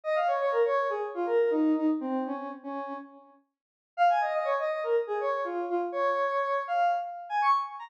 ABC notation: X:1
M:4/4
L:1/16
Q:1/4=122
K:Bbm
V:1 name="Lead 1 (square)"
e f d d B d2 A z F B2 E2 E z | C2 D2 z D3 z8 | f a e e d e2 B z A d2 F2 F z | d6 f2 z3 a d' z2 b |]